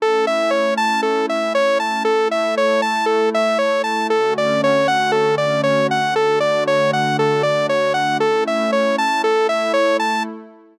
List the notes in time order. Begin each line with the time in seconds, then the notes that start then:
0.00 A3 C#4 E4 A4
0.27 E5
0.51 C#5
0.77 A5
1.02 A4
1.29 E5
1.55 C#5
1.80 A5
2.05 A3 E4 A4
2.31 E5
2.57 C#5
2.82 A5
3.06 A4
3.34 E5
3.58 C#5
3.84 A5
4.10 D3 A3 C#4 F#4 A4
4.38 D5
4.64 C#5
4.88 F#5
5.12 A4
5.38 D5
5.63 C#5
5.91 F#5
6.15 D3 A3 D4 F#4 A4
6.40 D5
6.67 C#5
6.93 F#5
7.19 A4
7.43 D5
7.69 C#5
7.94 F#5
8.20 A3 C#4 E4 A4
8.47 E5
8.72 C#5
8.98 A5
9.23 A3 E4 A4
9.49 E5
9.74 C#5
9.99 A5